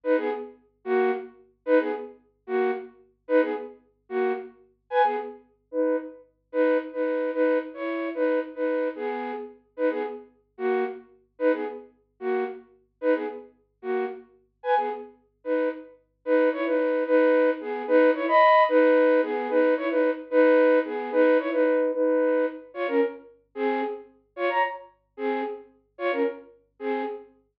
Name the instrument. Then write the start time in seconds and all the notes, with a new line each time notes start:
flute
0.03 D#4 B4
0.17 B3 G#4
0.85 A#3 F#4
1.66 D#4 B4
1.79 B3 G#4
2.47 A#3 F#4
3.28 D#4 B4
3.41 B3 G#4
4.09 A#3 F#4
4.90 B4 G#5
5.04 B3 G#4
5.71 D#4 B4
6.52 D#4 B4
6.93 D#4 B4
7.33 D#4 B4
7.74 E4 C#5
8.14 D#4 B4
8.55 D#4 B4
8.95 B3 G#4
9.77 D#4 B4
9.90 B3 G#4
10.58 A#3 F#4
11.39 D#4 B4
11.52 B3 G#4
12.20 A#3 F#4
13.01 D#4 B4
13.14 B3 G#4
13.82 A#3 F#4
14.63 B4 G#5
14.77 B3 G#4
15.44 D#4 B4
16.25 D#4 B4
16.52 E4 C#5
16.66 D#4 B4
17.06 D#4 B4
17.60 B3 G#4
17.87 D#4 B4
18.14 E4 C#5
18.28 D#5 B5
18.68 D#4 B4
19.22 B3 G#4
19.49 D#4 B4
19.77 E4 C#5
19.90 D#4 B4
20.31 D#4 B4
20.85 B3 G#4
21.12 D#4 B4
21.39 E4 C#5
21.52 D#4 B4
21.93 D#4 B4
22.74 F4 C#5
22.87 C#4 A#4
23.55 C4 G#4
24.36 F4 C#5
24.49 C#5 A#5
25.17 C4 G#4
25.98 F4 C#5
26.12 C#4 A#4
26.79 C4 G#4